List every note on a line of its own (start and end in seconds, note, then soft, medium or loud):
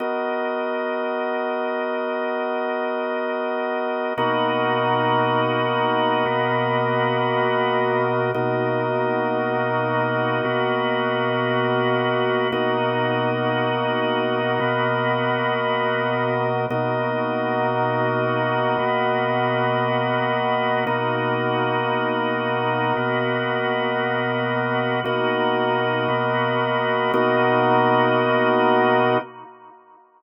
0.00 4.13 B3 medium
0.00 4.13 F#4 medium
0.00 4.13 A#4 medium
0.00 4.13 D#5 medium
4.17 6.24 B2 medium
4.17 6.24 A#3 medium
4.17 8.31 B3 medium
4.17 6.24 D#4 loud
4.17 6.24 F#4 loud
4.17 8.31 F#4 medium
4.17 8.31 A#4 medium
4.17 8.31 D#5 medium
6.26 8.32 B2 loud
6.26 8.32 A#3 loud
6.26 8.32 B3 loud
6.26 8.32 F#4 medium
8.34 10.41 B2 medium
8.34 10.41 A#3 medium
8.34 12.48 B3 medium
8.34 10.41 D#4 medium
8.34 12.48 F#4 medium
8.34 10.41 F#4 loud
8.34 12.48 A#4 medium
8.34 12.48 D#5 medium
10.44 12.51 B2 medium
10.44 12.51 A#3 medium
10.44 12.51 B3 medium
10.44 12.51 F#4 loud
12.52 14.59 B2 loud
12.52 14.59 A#3 medium
12.52 16.66 B3 medium
12.52 14.59 D#4 medium
12.52 14.59 F#4 loud
12.52 16.66 F#4 medium
12.52 16.66 A#4 medium
12.52 16.66 D#5 medium
14.60 16.67 B2 loud
14.60 16.67 A#3 medium
14.60 16.67 B3 loud
14.60 16.67 F#4 medium
16.70 18.77 B2 loud
16.70 18.77 A#3 medium
16.70 20.84 B3 medium
16.70 18.77 D#4 medium
16.70 18.77 F#4 loud
16.70 20.84 F#4 medium
16.70 20.84 A#4 medium
16.70 20.84 D#5 medium
18.79 20.85 B2 loud
18.79 20.85 A#3 loud
18.79 20.85 B3 loud
18.79 20.85 F#4 medium
20.86 22.93 B2 medium
20.86 22.93 A#3 loud
20.86 25.00 B3 medium
20.86 22.93 D#4 loud
20.86 22.93 F#4 medium
20.86 25.00 F#4 medium
20.86 25.00 A#4 medium
20.86 25.00 D#5 medium
22.97 25.03 B2 medium
22.97 25.03 A#3 medium
22.97 25.03 B3 loud
22.97 25.03 F#4 medium
25.04 26.07 B2 medium
25.04 26.07 A#3 loud
25.04 27.12 B3 medium
25.04 26.07 D#4 loud
25.04 26.07 F#4 loud
25.04 27.12 F#4 medium
25.04 27.12 A#4 medium
25.04 27.12 D#5 medium
26.08 27.11 B2 medium
26.08 27.11 A#3 medium
26.08 27.11 B3 medium
26.08 27.11 F#4 medium
27.13 29.17 B2 medium
27.13 29.17 A#3 loud
27.13 29.18 B3 loud
27.13 29.17 D#4 loud
27.13 29.17 F#4 medium
27.13 29.18 F#4 loud
27.13 29.18 A#4 medium
27.13 29.18 D#5 medium